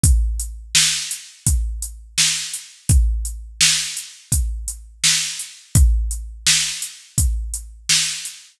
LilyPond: \new DrumStaff \drummode { \time 4/4 \tempo 4 = 84 <hh bd>8 hh8 sn8 hh8 <hh bd>8 hh8 sn8 hh8 | <hh bd>8 hh8 sn8 hh8 <hh bd>8 hh8 sn8 hh8 | <hh bd>8 hh8 sn8 hh8 <hh bd>8 hh8 sn8 hh8 | }